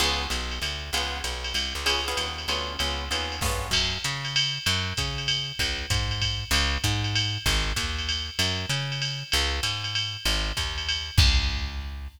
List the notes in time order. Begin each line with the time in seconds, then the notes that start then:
0.00 C#2 B3 C#4 F4 G#4, crash, ride
0.30 B1, hi-hat pedal, ride
0.51 ride
0.62 D2, ride
0.93 C#2 B3 C#4 F4 G#4, ride
1.24 B1, hi-hat pedal, ride
1.44 ride
1.54 C2, ride
1.75 C#2
1.86 B3 C#4 F4 G#4, ride
2.08 B3 C#4 F4 G#4
2.17 D#2, hi-hat pedal, ride
2.38 ride
2.48 D2 B3 C#4 F4 G#4, ride
2.79 C#2 B3 C#4 F4 G#4, ride
3.11 D#2 B3 C#4 F4 G#4, hi-hat pedal, ride
3.32 ride
3.41 G2 B3 C#4 F4 G#4, kick, snare
3.71 F#2, kick, crash, ride
4.04 C#3, hi-hat pedal, ride
4.25 ride
4.36 ride
4.66 F#2, ride
4.97 C#3, kick, hi-hat pedal, ride
5.18 ride
5.28 ride
5.59 C#2, kick, ride
5.90 G#2, kick, hi-hat pedal, ride
6.11 ride
6.22 kick, ride
6.51 C#2, ride
6.84 G#2, kick, hi-hat pedal, ride
7.04 ride
7.15 ride
7.46 G#1, kick, ride
7.76 D#2, kick, hi-hat pedal, ride
7.99 ride
8.09 ride
8.39 F#2, ride
8.69 C#3, hi-hat pedal, ride
8.92 ride
9.02 ride
9.32 C#2, ride
9.63 G#2, hi-hat pedal, ride
9.84 ride
9.95 ride
10.25 G#1, ride
10.57 D#2, kick, hi-hat pedal, ride
10.78 ride
10.89 ride
11.18 C#2, kick, crash